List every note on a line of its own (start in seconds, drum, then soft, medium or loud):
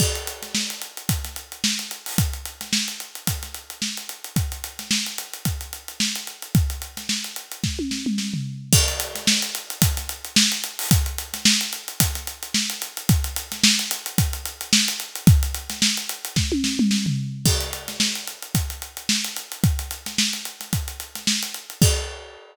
0.00 kick medium
0.00 crash loud
0.15 closed hi-hat medium
0.27 closed hi-hat medium
0.42 snare soft
0.42 closed hi-hat medium
0.55 snare medium
0.70 closed hi-hat medium
0.81 closed hi-hat medium
0.97 closed hi-hat medium
1.09 kick medium
1.09 closed hi-hat medium
1.24 snare soft
1.24 closed hi-hat medium
1.36 closed hi-hat medium
1.52 closed hi-hat medium
1.64 snare loud
1.79 snare soft
1.79 closed hi-hat medium
1.91 closed hi-hat medium
2.06 open hi-hat medium
2.18 kick medium
2.18 closed hi-hat loud
2.33 closed hi-hat medium
2.45 closed hi-hat medium
2.61 snare soft
2.61 closed hi-hat medium
2.73 snare loud
2.88 closed hi-hat medium
3.00 closed hi-hat medium
3.15 closed hi-hat medium
3.27 kick medium
3.27 closed hi-hat loud
3.43 snare soft
3.43 closed hi-hat medium
3.54 closed hi-hat medium
3.70 closed hi-hat medium
3.82 snare medium
3.97 closed hi-hat medium
4.09 closed hi-hat medium
4.24 closed hi-hat medium
4.36 kick medium
4.36 closed hi-hat medium
4.52 closed hi-hat medium
4.64 closed hi-hat medium
4.79 snare soft
4.79 closed hi-hat medium
4.91 snare loud
5.06 snare soft
5.06 closed hi-hat medium
5.18 closed hi-hat medium
5.33 closed hi-hat medium
5.45 kick medium
5.45 closed hi-hat medium
5.61 closed hi-hat medium
5.73 closed hi-hat medium
5.88 closed hi-hat medium
6.00 snare loud
6.15 snare soft
6.15 closed hi-hat medium
6.27 closed hi-hat medium
6.42 closed hi-hat medium
6.55 kick loud
6.55 closed hi-hat medium
6.70 closed hi-hat medium
6.82 closed hi-hat medium
6.97 snare medium
6.97 closed hi-hat medium
7.09 snare medium
7.24 closed hi-hat medium
7.36 closed hi-hat medium
7.51 closed hi-hat medium
7.64 kick medium
7.64 snare medium
7.79 high tom medium
7.91 snare medium
8.06 mid tom medium
8.18 snare medium
8.34 floor tom medium
8.73 kick loud
8.73 crash loud
8.88 closed hi-hat medium
9.00 closed hi-hat medium
9.15 snare soft
9.15 closed hi-hat medium
9.27 snare loud
9.42 closed hi-hat medium
9.55 closed hi-hat medium
9.70 closed hi-hat medium
9.82 kick loud
9.82 closed hi-hat loud
9.97 snare soft
9.97 closed hi-hat medium
10.09 closed hi-hat medium
10.25 closed hi-hat medium
10.36 snare loud
10.52 snare soft
10.52 closed hi-hat medium
10.64 closed hi-hat medium
10.79 open hi-hat medium
10.91 kick loud
10.91 closed hi-hat loud
11.06 closed hi-hat medium
11.18 closed hi-hat medium
11.34 snare soft
11.34 closed hi-hat medium
11.45 snare loud
11.61 closed hi-hat medium
11.73 closed hi-hat medium
11.88 closed hi-hat medium
12.00 kick medium
12.00 closed hi-hat loud
12.15 snare soft
12.15 closed hi-hat medium
12.27 closed hi-hat medium
12.43 closed hi-hat medium
12.54 snare loud
12.70 closed hi-hat medium
12.82 closed hi-hat medium
12.97 closed hi-hat medium
13.09 kick loud
13.09 closed hi-hat loud
13.24 closed hi-hat medium
13.36 closed hi-hat medium
13.52 snare medium
13.52 closed hi-hat medium
13.64 snare loud
13.79 snare soft
13.79 closed hi-hat medium
13.91 closed hi-hat medium
14.06 closed hi-hat medium
14.18 kick medium
14.18 closed hi-hat loud
14.33 closed hi-hat medium
14.45 closed hi-hat medium
14.61 closed hi-hat medium
14.73 snare loud
14.88 snare soft
14.88 closed hi-hat medium
15.00 closed hi-hat medium
15.15 closed hi-hat medium
15.27 kick loud
15.27 closed hi-hat medium
15.43 closed hi-hat medium
15.54 closed hi-hat medium
15.70 snare medium
15.70 closed hi-hat medium
15.82 snare loud
15.97 closed hi-hat medium
16.09 closed hi-hat medium
16.25 closed hi-hat medium
16.36 kick medium
16.36 snare medium
16.52 high tom medium
16.64 snare medium
16.79 mid tom loud
16.91 snare medium
17.06 floor tom medium
17.46 kick medium
17.46 crash loud
17.60 closed hi-hat medium
17.73 closed hi-hat medium
17.88 snare medium
17.88 closed hi-hat medium
18.00 snare loud
18.15 closed hi-hat medium
18.27 closed hi-hat medium
18.42 closed hi-hat medium
18.55 kick medium
18.55 closed hi-hat medium
18.70 closed hi-hat medium
18.82 closed hi-hat medium
18.97 closed hi-hat medium
19.09 snare loud
19.24 snare soft
19.24 closed hi-hat medium
19.36 closed hi-hat medium
19.52 closed hi-hat medium
19.64 kick loud
19.64 closed hi-hat medium
19.79 closed hi-hat medium
19.91 closed hi-hat medium
20.06 snare medium
20.06 closed hi-hat medium
20.18 snare loud
20.33 snare soft
20.33 closed hi-hat medium
20.45 closed hi-hat medium
20.60 snare soft
20.60 closed hi-hat medium
20.73 kick medium
20.73 closed hi-hat medium
20.88 closed hi-hat medium
21.00 closed hi-hat medium
21.15 snare soft
21.15 closed hi-hat medium
21.27 snare loud
21.43 closed hi-hat medium
21.54 closed hi-hat medium
21.70 closed hi-hat medium
21.82 kick loud
21.82 crash loud